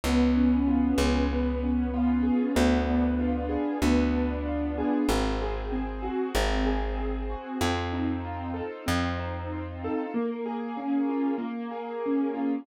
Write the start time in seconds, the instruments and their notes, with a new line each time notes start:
0.04 electric bass (finger) C#2, acoustic grand piano B3
0.35 acoustic grand piano C#4
0.68 acoustic grand piano F4
0.98 electric bass (finger) C#2, acoustic grand piano G#4
1.31 acoustic grand piano B3
1.63 acoustic grand piano C#4
1.94 acoustic grand piano F4
2.23 acoustic grand piano G#4
2.55 electric bass (finger) D2, acoustic grand piano B3
2.89 acoustic grand piano D4
3.19 acoustic grand piano F4
3.49 acoustic grand piano G#4
3.82 electric bass (finger) D2, acoustic grand piano B3
4.15 acoustic grand piano D4
4.46 acoustic grand piano F4
4.78 acoustic grand piano G#4
5.09 electric bass (finger) G#1, acoustic grand piano C4
5.41 acoustic grand piano G#4
5.72 acoustic grand piano C4
6.03 acoustic grand piano F#4
6.35 electric bass (finger) G#1, acoustic grand piano C4
6.66 acoustic grand piano G#4
6.98 acoustic grand piano C4
7.30 acoustic grand piano F#4
7.61 electric bass (finger) F2, acoustic grand piano C4
7.92 acoustic grand piano D#4
8.25 acoustic grand piano F4
8.54 acoustic grand piano A4
8.86 electric bass (finger) F2, acoustic grand piano C4
9.18 acoustic grand piano D#4
9.52 acoustic grand piano F4
9.84 acoustic grand piano A4
10.14 acoustic grand piano A#3
10.46 acoustic grand piano G#4
10.77 acoustic grand piano C#4
11.09 acoustic grand piano F4
11.38 acoustic grand piano A#3
11.71 acoustic grand piano G#4
12.06 acoustic grand piano C#4
12.34 acoustic grand piano F4